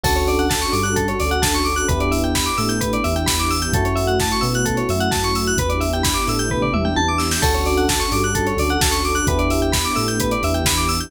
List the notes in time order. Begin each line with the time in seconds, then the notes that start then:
0.03 D2 C#4 D4 F#4 A4, kick, crash
0.16 C#5, closed hi-hat
0.27 D5, open hi-hat
0.39 F#5, closed hi-hat
0.50 A5, kick, snare
0.62 C#6, closed hi-hat
0.72 G2 G3 D6, open hi-hat
0.83 F#6, closed hi-hat
0.96 A4, kick, closed hi-hat
1.08 C#5, closed hi-hat
1.20 D2 D3 D5, open hi-hat
1.31 F#5, closed hi-hat
1.42 D2 D3 A5, kick, snare
1.54 C#6, closed hi-hat
1.65 D6, open hi-hat
1.76 F#6, closed hi-hat
1.88 E2 B3 D4 E4 G4 B4, kick, closed hi-hat
2.00 D5, closed hi-hat
2.11 E5, open hi-hat
2.23 G5, closed hi-hat
2.35 B5, kick, snare
2.46 D6, closed hi-hat
2.58 A2 A3 E6, open hi-hat
2.69 G6, closed hi-hat
2.81 B4, kick, closed hi-hat
2.93 D5, closed hi-hat
3.04 E2 E3 E5, open hi-hat
3.16 G5, closed hi-hat
3.26 E2 E3 B5, kick, snare
3.39 D6, closed hi-hat
3.50 E6, open hi-hat
3.62 G6, closed hi-hat
3.73 F#2 A3 C#4 E4 F#4 A4, kick, closed hi-hat
3.85 C#5, closed hi-hat
3.96 E5, open hi-hat
4.07 F#5, closed hi-hat
4.19 A5, kick, snare
4.31 C#6, closed hi-hat
4.41 B2 B3 E6, open hi-hat
4.54 F#6, closed hi-hat
4.65 A4, kick, closed hi-hat
4.77 C#5, closed hi-hat
4.89 F#2 F#3 E5, open hi-hat
5.00 F#5, closed hi-hat
5.11 F#2 F#3 A5, kick, snare
5.24 C#6, closed hi-hat
5.35 E6, open hi-hat
5.46 F#6, closed hi-hat
5.57 E2 B3 D4 E4 G4 B4, kick, closed hi-hat
5.69 D5, closed hi-hat
5.80 E5, open hi-hat
5.93 G5, closed hi-hat
6.03 B5, kick, snare
6.14 D6, closed hi-hat
6.27 A2 A3 E6, open hi-hat
6.39 G6, closed hi-hat
6.50 B4, kick, floor tom
6.62 D5, floor tom
6.73 E2 E3 E5, mid tom
6.85 G5, mid tom
6.96 E2 E3 A5, high tom
7.08 D6
7.18 E6, snare
7.31 G6, snare
7.42 D2 C#4 D4 F#4 A4, kick, crash
7.54 C#5, closed hi-hat
7.66 D5, open hi-hat
7.77 F#5, closed hi-hat
7.89 A5, kick, snare
8.00 C#6, closed hi-hat
8.12 G2 G3 D6, open hi-hat
8.23 F#6, closed hi-hat
8.35 A4, kick, closed hi-hat
8.47 C#5, closed hi-hat
8.57 D2 D3 D5, open hi-hat
8.69 F#5, closed hi-hat
8.81 D2 D3 A5, kick, snare
8.91 C#6, closed hi-hat
9.04 D6, open hi-hat
9.15 F#6, closed hi-hat
9.27 E2 B3 D4 E4 G4 B4, kick, closed hi-hat
9.39 D5, closed hi-hat
9.50 E5, open hi-hat
9.62 G5, closed hi-hat
9.72 B5, kick, snare
9.85 D6, closed hi-hat
9.95 A2 A3 E6, open hi-hat
10.08 G6, closed hi-hat
10.20 B4, kick, closed hi-hat
10.31 D5, closed hi-hat
10.42 E2 E3 E5, open hi-hat
10.54 G5, closed hi-hat
10.65 E2 E3 B5, kick, snare
10.77 D6, closed hi-hat
10.89 E6, open hi-hat
11.00 G6, closed hi-hat